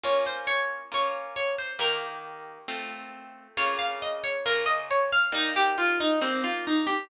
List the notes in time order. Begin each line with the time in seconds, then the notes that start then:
0.03 A#3 C#4 F4 C#5
0.26 C5
0.47 C#5
0.92 A#3 C#4 F4 C#5
1.36 C#5
1.58 C5
1.79 D#3 A#3 G4 A#4
2.68 A3 C4 F4
3.57 C#3 A#3 F4 C#5
3.79 F5
4.02 D#5
4.24 C#5
4.46 C#3 A#3 F4 A#4
4.66 D#5
4.91 C#5
5.12 F5
5.32 G3 A#3 D#4
5.56 G4
5.78 F4
6.00 D#4
6.21 G3 A#3 C4 D#4
6.44 F4
6.67 D#4
6.87 G4